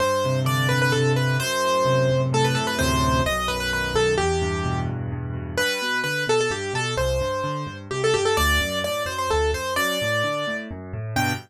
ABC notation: X:1
M:3/4
L:1/16
Q:1/4=129
K:G
V:1 name="Acoustic Grand Piano"
c4 d2 B B A2 B2 | c8 A B A B | c4 ^d2 B B B2 A2 | G6 z6 |
B4 B2 A A G2 A2 | c8 G A G A | d4 d2 c c A2 c2 | d8 z4 |
g4 z8 |]
V:2 name="Acoustic Grand Piano" clef=bass
G,,2 C,2 D,2 G,,2 C,2 D,2 | F,,2 A,,2 C,2 F,,2 A,,2 C,2 | [D,,F,,A,,C,]4 B,,,2 F,,2 ^D,2 B,,,2 | E,,2 G,,2 B,,2 E,,2 G,,2 B,,2 |
G,,2 B,,2 D,2 B,,2 G,,2 B,,2 | C,,2 G,,2 D,2 G,,2 C,,2 G,,2 | D,,2 F,,2 A,,2 F,,2 D,,2 F,,2 | F,,2 A,,2 D,2 A,,2 F,,2 A,,2 |
[G,,B,,D,]4 z8 |]